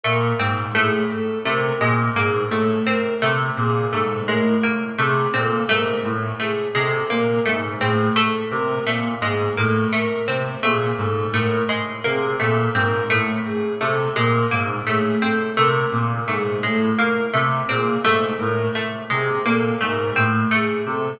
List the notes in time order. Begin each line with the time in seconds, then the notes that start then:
0.04 A#2 A3 A#4
0.39 G#2 C4
0.75 A2 A3 G#4
1.10 A4
1.44 C3 A3 A#4
1.81 A#2 G#3
2.15 G#2 A#3 G#4
2.51 A2 A3 A4
2.86 C4 A#4
3.22 C3 A3
3.57 A#2 G#4
3.91 G#2 A3 A4
4.26 A2 G#3 A#4
4.63 A#3
4.98 C3 A3 G#4
5.34 A#2 C4 A4
5.69 G#2 A3 A#4
6.04 A2
6.39 A3 G#4
6.75 C3 G#3 A4
7.10 A#2 A#3 A#4
7.45 G#2 A3
7.78 A2 C4 G#4
8.16 A3 A4
8.50 C3 A#4
8.86 A#2 A3
9.21 G#2 G#3 G#4
9.57 A2 A#3 A4
9.92 A3 A#4
10.28 C3 C4
10.62 A#2 A3 G#4
10.97 G#2 A4
11.33 A2 A3 A#4
11.69 G#3
12.04 C3 A#3 G#4
12.40 A#2 A3 A4
12.74 G#2 C4 A#4
13.10 A2 A3
13.45 G#4
13.81 C3 A3 A4
14.15 A#2 G#3 A#4
14.51 G#2 A#3
14.87 A2 A3 G#4
15.21 C4 A4
15.56 C3 A3 A#4
15.92 A#2
16.27 G#2 A3 G#4
16.63 A2 G#3 A4
16.96 A#3 A#4
17.33 C3 A3
17.68 A#2 C4 G#4
18.04 G#2 A3 A4
18.38 A2 A#4
18.75 A3
19.10 C3 G#3 G#4
19.44 A#2 A#3 A4
19.81 G#2 A3 A#4
20.16 A2 C4
20.51 A3 G#4
20.86 C3 A4